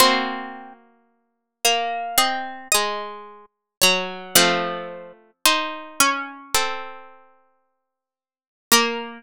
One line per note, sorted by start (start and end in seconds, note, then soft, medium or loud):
0.00 3.69 A#3 loud
0.00 1.48 C4 loud
0.00 3.69 F#4 loud
0.00 0.91 C5 loud
1.65 2.17 A#3 medium
2.18 2.68 C4 medium
2.18 2.69 D#5 medium
2.72 3.76 G#3 medium
2.72 3.24 D#5 loud
3.82 4.35 F#3 loud
3.82 4.32 C#5 medium
4.35 6.56 F3 loud
4.35 5.31 A3 loud
4.35 5.87 C4 loud
4.35 5.31 F4 loud
5.45 6.41 D#4 loud
5.45 6.41 C5 loud
6.00 7.49 C#4 loud
6.55 8.62 C4 medium
6.55 8.62 A4 loud
8.72 9.22 A#3 loud
8.72 9.22 A#4 loud